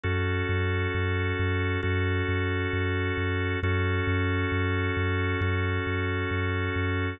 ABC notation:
X:1
M:4/4
L:1/8
Q:1/4=67
K:F#dor
V:1 name="Drawbar Organ"
[CFA]4 [CFA]4 | [CFA]4 [CFA]4 |]
V:2 name="Synth Bass 2" clef=bass
F,, F,, F,, F,, F,, F,, F,, F,, | F,, F,, F,, F,, F,, F,, F,, F,, |]